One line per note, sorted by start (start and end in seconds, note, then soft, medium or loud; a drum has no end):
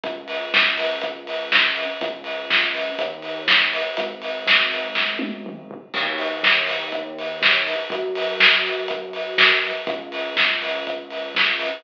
0.03 1.85 C#2 medium
0.03 kick loud
0.03 closed hi-hat loud
0.28 open hi-hat medium
0.54 kick loud
0.54 snare loud
0.78 open hi-hat loud
1.01 kick loud
1.01 closed hi-hat loud
1.27 open hi-hat medium
1.52 kick loud
1.52 snare loud
1.76 open hi-hat medium
2.01 2.91 C#2 medium
2.01 kick loud
2.01 closed hi-hat loud
2.24 open hi-hat medium
2.50 kick loud
2.50 snare loud
2.75 open hi-hat medium
2.99 3.90 D#2 medium
2.99 kick medium
2.99 closed hi-hat loud
3.22 open hi-hat medium
3.48 kick loud
3.48 snare loud
3.73 open hi-hat medium
3.97 5.79 G#1 medium
3.97 kick loud
3.97 closed hi-hat loud
4.22 open hi-hat medium
4.47 kick loud
4.47 snare loud
4.72 open hi-hat medium
4.95 kick medium
4.95 snare loud
5.19 high tom medium
5.46 mid tom loud
5.71 floor tom loud
5.94 7.75 D#2 medium
5.94 kick loud
5.94 crash loud
6.18 open hi-hat medium
6.43 kick medium
6.43 snare loud
6.67 open hi-hat loud
6.92 kick medium
6.92 closed hi-hat loud
7.19 open hi-hat medium
7.42 kick loud
7.42 snare loud
7.67 open hi-hat medium
7.90 9.72 F#2 medium
7.90 kick loud
7.90 closed hi-hat loud
8.15 open hi-hat loud
8.40 kick loud
8.40 snare loud
8.66 open hi-hat medium
8.88 kick loud
8.88 closed hi-hat loud
9.13 open hi-hat medium
9.38 kick loud
9.38 snare loud
9.64 open hi-hat medium
9.87 11.69 C#2 medium
9.87 kick loud
9.87 closed hi-hat loud
10.12 open hi-hat medium
10.37 kick loud
10.37 snare loud
10.62 open hi-hat loud
10.87 kick medium
10.87 closed hi-hat loud
11.10 open hi-hat medium
11.35 kick medium
11.35 snare loud
11.59 open hi-hat medium